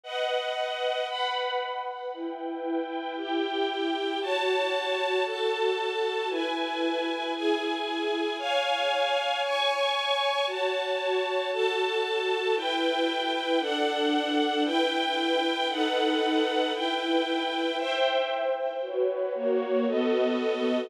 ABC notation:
X:1
M:4/4
L:1/8
Q:1/4=115
K:Em
V:1 name="String Ensemble 1"
[B^df]4 [Bfb]4 | [EBg]4 [EGg]4 | [K:F#m] [Fca]4 [FAa]4 | [EBg]4 [EGg]4 |
[c^eg]4 [cgc']4 | [Fca]4 [FAa]4 | [K:Em] [EBg]4 [DAf]4 | [EBg]4 [^DABf]4 |
[EBg]4 [ceg]4 | [FB^c]2 [^A,Fc]2 [B,F=A^d]4 |]